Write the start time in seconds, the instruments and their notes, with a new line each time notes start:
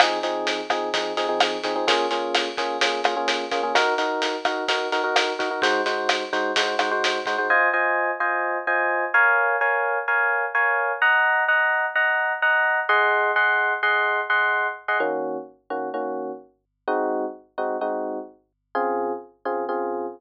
0.00 electric piano 1 F3 C4 D#4 G#4, kick, cross-stick, closed hi-hat
0.23 electric piano 1 F3 C4 D#4 G#4, closed hi-hat
0.47 closed hi-hat
0.70 electric piano 1 F3 C4 D#4 G#4, kick, cross-stick, closed hi-hat
0.94 electric piano 1 F3 C4 D#4 G#4, kick, closed hi-hat
1.17 electric piano 1 F3 C4 D#4 G#4, closed hi-hat
1.29 electric piano 1 F3 C4 D#4 G#4
1.40 cross-stick, closed hi-hat
1.64 electric piano 1 F3 C4 D#4 G#4, kick, closed hi-hat
1.76 electric piano 1 F3 C4 D#4 G#4
1.88 electric piano 1 A#3 C#4 F4 G#4, kick, closed hi-hat
2.11 electric piano 1 A#3 C#4 F4 G#4, closed hi-hat
2.35 cross-stick, closed hi-hat
2.57 electric piano 1 A#3 C#4 F4 G#4, kick, closed hi-hat
2.81 electric piano 1 A#3 C#4 F4 G#4, kick, closed hi-hat
3.04 electric piano 1 A#3 C#4 F4 G#4, cross-stick, closed hi-hat
3.17 electric piano 1 A#3 C#4 F4 G#4
3.28 closed hi-hat
3.51 electric piano 1 A#3 C#4 F4 G#4, kick, closed hi-hat
3.63 electric piano 1 A#3 C#4 F4 G#4
3.75 electric piano 1 D#4 F#4 A#4, kick, cross-stick, closed hi-hat
3.98 electric piano 1 D#4 F#4 A#4, closed hi-hat
4.22 closed hi-hat
4.45 electric piano 1 D#4 F#4 A#4, kick, cross-stick, closed hi-hat
4.68 electric piano 1 D#4 F#4 A#4, kick, closed hi-hat
4.92 electric piano 1 D#4 F#4 A#4, closed hi-hat
5.04 electric piano 1 D#4 F#4 A#4
5.16 cross-stick, closed hi-hat
5.39 electric piano 1 D#4 F#4 A#4, kick, closed hi-hat
5.51 electric piano 1 D#4 F#4 A#4
5.62 electric piano 1 G#3 D#4 F#4 C5, kick, closed hi-hat
5.86 electric piano 1 G#3 D#4 F#4 C5, closed hi-hat
6.09 cross-stick, closed hi-hat
6.33 electric piano 1 G#3 D#4 F#4 C5, kick, closed hi-hat
6.56 electric piano 1 G#3 D#4 F#4 C5, kick, closed hi-hat
6.79 electric piano 1 G#3 D#4 F#4 C5, cross-stick, closed hi-hat
6.91 electric piano 1 G#3 D#4 F#4 C5
7.04 closed hi-hat
7.26 electric piano 1 G#3 D#4 F#4 C5, kick, closed hi-hat
7.38 electric piano 1 G#3 D#4 F#4 C5
7.50 electric piano 1 F4 C5 D#5 G#5
7.73 electric piano 1 F4 C5 D#5 G#5
8.20 electric piano 1 F4 C5 D#5 G#5
8.67 electric piano 1 F4 C5 D#5 G#5
9.14 electric piano 1 A#4 C#5 F5 G#5
9.61 electric piano 1 A#4 C#5 F5 G#5
10.08 electric piano 1 A#4 C#5 F5 G#5
10.55 electric piano 1 A#4 C#5 F5 G#5
11.02 electric piano 1 D#5 F#5 A#5
11.48 electric piano 1 D#5 F#5 A#5
11.95 electric piano 1 D#5 F#5 A#5
12.42 electric piano 1 D#5 F#5 A#5
12.89 electric piano 1 G#4 D#5 F#5 C6
13.36 electric piano 1 G#4 D#5 F#5 C6
13.83 electric piano 1 G#4 D#5 F#5 C6
14.30 electric piano 1 G#4 D#5 F#5 C6
14.88 electric piano 1 G#4 D#5 F#5 C6
15.00 electric piano 1 D#3 A#3 C#4 F#4
15.70 electric piano 1 D#3 A#3 C#4 F#4
15.94 electric piano 1 D#3 A#3 C#4 F#4
16.88 electric piano 1 G#3 C4 D#4 F#4
17.58 electric piano 1 G#3 C4 D#4 F#4
17.81 electric piano 1 G#3 C4 D#4 F#4
18.75 electric piano 1 C#3 C4 F4 G#4
19.45 electric piano 1 C#3 C4 F4 G#4
19.69 electric piano 1 C#3 C4 F4 G#4